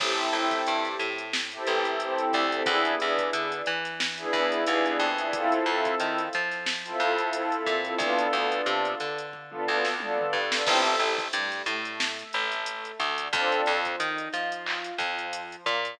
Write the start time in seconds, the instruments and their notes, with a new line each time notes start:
0.00 electric bass (finger) A1, pad 2 (warm) C4 E4 G4 A4, kick, crash
0.18 closed hi-hat
0.33 electric bass (finger) A1, pad 2 (warm) C4 E4 G4 A4, closed hi-hat
0.51 kick, closed hi-hat
0.67 electric bass (finger) G2, closed hi-hat
0.85 closed hi-hat
0.99 electric bass (finger) A2, closed hi-hat
1.18 closed hi-hat
1.33 snare
1.52 pad 2 (warm) C4 E4 G4 A4, closed hi-hat
1.66 electric bass (finger) A1, pad 2 (warm) C4 E4 G4 A4, closed hi-hat
1.85 closed hi-hat
2.00 pad 2 (warm) C4 E4 G4 A4, closed hi-hat
2.18 closed hi-hat
2.33 electric bass (finger) D2, kick, closed hi-hat
2.52 pad 2 (warm) C4 E4 G4 A4, closed hi-hat
2.66 electric bass (finger) E2, pad 2 (warm) B3 D4 E4 G#4, kick, closed hi-hat
2.85 closed hi-hat
2.99 electric bass (finger) E2, pad 2 (warm) B3 D4 E4 G#4, closed hi-hat
3.18 kick, closed hi-hat
3.33 electric bass (finger) D3, closed hi-hat
3.52 closed hi-hat
3.66 electric bass (finger) E3, closed hi-hat
3.85 snare, closed hi-hat
4.00 snare
4.17 pad 2 (warm) B3 D4 E4 G#4, closed hi-hat
4.32 electric bass (finger) E2, pad 2 (warm) B3 D4 E4 G#4, kick, closed hi-hat
4.52 closed hi-hat
4.65 electric bass (finger) D#2, pad 2 (warm) B3 D4 E4 G#4, closed hi-hat
4.86 closed hi-hat
4.99 electric bass (finger) F2, closed hi-hat
5.17 pad 2 (warm) B3 D4 E4 G#4, closed hi-hat
5.33 pad 2 (warm) C4 E4 F4 A4, kick, closed hi-hat
5.52 closed hi-hat
5.65 electric bass (finger) F2, pad 2 (warm) C4 E4 F4 A4, closed hi-hat
5.85 kick, closed hi-hat
6.00 electric bass (finger) D#3, closed hi-hat
6.18 closed hi-hat
6.33 electric bass (finger) F3, closed hi-hat
6.52 snare, closed hi-hat
6.66 snare
6.85 pad 2 (warm) C4 E4 F4 A4, closed hi-hat
7.00 electric bass (finger) F2, pad 2 (warm) C4 E4 F4 A4, closed hi-hat
7.18 closed hi-hat
7.32 pad 2 (warm) C4 E4 F4 A4, closed hi-hat
7.52 closed hi-hat
7.66 electric bass (finger) A#2, kick, snare, closed hi-hat
7.84 pad 2 (warm) C4 E4 F4 A4, closed hi-hat
7.98 electric bass (finger) D2, pad 2 (warm) B3 D4 F4 A4, kick, closed hi-hat
8.19 closed hi-hat
8.33 electric bass (finger) D2, pad 2 (warm) B3 D4 F4 A4, closed hi-hat
8.52 closed hi-hat
8.66 electric bass (finger) C3, closed hi-hat
8.85 closed hi-hat
9.00 electric bass (finger) D3, closed hi-hat
9.18 closed hi-hat
9.33 kick
9.50 pad 2 (warm) B3 D4 F4 A4, mid tom
9.65 electric bass (finger) D2, pad 2 (warm) B3 D4 F4 A4, floor tom
9.85 snare
10.00 pad 2 (warm) B3 D4 F4 A4, high tom
10.18 mid tom
10.33 electric bass (finger) G2, floor tom
10.52 pad 2 (warm) B3 D4 F4 A4, snare
10.66 electric bass (finger) A1, pad 2 (warm) C4 E4 G4 A4, kick, crash
10.85 closed hi-hat
10.99 electric bass (finger) A1, pad 2 (warm) A3, closed hi-hat
11.18 kick, closed hi-hat
11.32 electric bass (finger) G2, pad 2 (warm) G3, closed hi-hat
11.52 closed hi-hat
11.66 electric bass (finger) A2, pad 2 (warm) A3, closed hi-hat
11.85 closed hi-hat
12.00 snare
12.19 closed hi-hat
12.33 electric bass (finger) A1, pad 2 (warm) A3, closed hi-hat
12.52 snare, closed hi-hat
12.66 closed hi-hat
12.85 closed hi-hat
13.00 electric bass (finger) D2, pad 2 (warm) D3, kick, closed hi-hat
13.18 closed hi-hat
13.33 electric bass (finger) F2, pad 2 (warm) C4 D4 F4 A4, kick, closed hi-hat
13.52 closed hi-hat
13.66 electric bass (finger) F2, pad 2 (warm) F3, closed hi-hat
13.85 kick, closed hi-hat
14.00 electric bass (finger) D#3, pad 2 (warm) D#4, closed hi-hat
14.18 closed hi-hat
14.33 electric bass (finger) F3, pad 2 (warm) F4, snare, closed hi-hat
14.52 closed hi-hat
14.66 clap
14.84 closed hi-hat
14.98 electric bass (finger) F2, pad 2 (warm) F3, kick, closed hi-hat
15.19 closed hi-hat
15.33 closed hi-hat
15.52 closed hi-hat
15.66 electric bass (finger) A#2, pad 2 (warm) A#3, kick, closed hi-hat
15.85 closed hi-hat